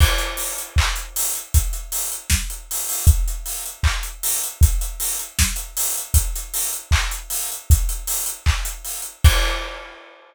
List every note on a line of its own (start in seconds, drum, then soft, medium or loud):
0.00 kick medium
0.00 crash loud
0.18 closed hi-hat medium
0.37 open hi-hat medium
0.58 closed hi-hat medium
0.76 kick medium
0.76 clap loud
0.96 closed hi-hat medium
1.16 open hi-hat medium
1.35 closed hi-hat medium
1.54 kick medium
1.54 closed hi-hat medium
1.73 closed hi-hat medium
1.92 open hi-hat medium
2.12 closed hi-hat medium
2.30 kick medium
2.30 snare medium
2.50 closed hi-hat medium
2.71 open hi-hat medium
2.89 open hi-hat medium
3.07 kick loud
3.07 closed hi-hat medium
3.28 closed hi-hat medium
3.46 open hi-hat medium
3.66 closed hi-hat medium
3.83 kick medium
3.83 clap medium
4.03 closed hi-hat medium
4.23 open hi-hat medium
4.43 closed hi-hat medium
4.61 kick loud
4.61 closed hi-hat medium
4.81 closed hi-hat medium
5.00 open hi-hat medium
5.19 closed hi-hat medium
5.39 kick medium
5.39 snare loud
5.56 closed hi-hat medium
5.77 open hi-hat medium
5.97 closed hi-hat medium
6.14 kick medium
6.14 closed hi-hat medium
6.36 closed hi-hat medium
6.54 open hi-hat medium
6.73 closed hi-hat medium
6.91 kick medium
6.91 clap loud
7.11 closed hi-hat medium
7.30 open hi-hat medium
7.52 closed hi-hat medium
7.70 kick medium
7.70 closed hi-hat medium
7.89 closed hi-hat medium
8.07 open hi-hat medium
8.26 closed hi-hat medium
8.46 kick medium
8.46 clap medium
8.65 closed hi-hat medium
8.85 open hi-hat medium
9.02 closed hi-hat medium
9.24 kick loud
9.24 crash loud